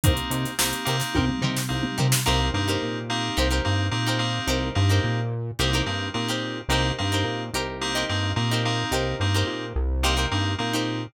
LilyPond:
<<
  \new Staff \with { instrumentName = "Acoustic Guitar (steel)" } { \time 4/4 \key c \dorian \tempo 4 = 108 <ees' g' bes' c''>8 <ees' g' bes' c''>4 <ees' g' bes' c''>8 <ees' g' bes' c''>8 <ees' g' bes' c''>4 <ees' g' bes' c''>8 | <ees' g' bes' c''>8. <ees' g' bes' c''>4~ <ees' g' bes' c''>16 <ees' g' bes' c''>16 <ees' g' bes' c''>4 <ees' g' bes' c''>8. | <ees' g' bes' c''>8. <ees' g' bes' c''>4~ <ees' g' bes' c''>16 <ees' g' bes' c''>16 <ees' g' bes' c''>4 <ees' g' bes' c''>8. | <ees' g' bes' c''>8. <ees' g' bes' c''>8. <ees' g' bes' c''>8. <ees' g' bes' c''>4 <ees' g' bes' c''>8. |
<ees' g' bes' c''>8. <ees' g' bes' c''>4~ <ees' g' bes' c''>16 <ees' g' bes' c''>16 <ees' g' bes' c''>4 <ees' g' bes' c''>8. | }
  \new Staff \with { instrumentName = "Electric Piano 2" } { \time 4/4 \key c \dorian <bes c' ees' g'>4 <bes c' ees' g'>8 <bes c' ees' g'>4. <bes c' ees' g'>4 | <bes c' ees' g'>8 <bes c' ees' g'>4 <bes c' ees' g'>4 <bes c' ees' g'>8 <bes c' ees' g'>8 <bes c' ees' g'>8~ | <bes c' ees' g'>8 <bes c' ees' g'>4. <bes c' ees' g'>8 <bes c' ees' g'>8 <bes c' ees' g'>4 | <bes c' ees' g'>8 <bes c' ees' g'>4. <bes c' ees' g'>8 <bes c' ees' g'>8 <bes c' ees' g'>8 <bes c' ees' g'>8~ |
<bes c' ees' g'>8 <bes c' ees' g'>4. <bes c' ees' g'>8 <bes c' ees' g'>8 <bes c' ees' g'>4 | }
  \new Staff \with { instrumentName = "Synth Bass 1" } { \clef bass \time 4/4 \key c \dorian c,8 c8 c,8 c8 c,8 c8 c,8 c8 | c,8 g,8 bes,4 c,8 g,8 bes,4 | c,8 g,8 bes,4 c,8 g,8 bes,4 | c,8 g,8 bes,8 c,4 g,8 bes,4 |
c,8 g,8 bes,8 c,4 g,8 bes,4 | }
  \new DrumStaff \with { instrumentName = "Drums" } \drummode { \time 4/4 <hh bd>16 hh16 hh16 <hh sn>16 sn16 hh16 <hh sn>16 <hh sn>16 <bd tommh>16 toml16 tomfh16 sn16 r16 toml16 tomfh16 sn16 | r4 r4 r4 r4 | r4 r4 r4 r4 | r4 r4 r4 r4 |
r4 r4 r4 r4 | }
>>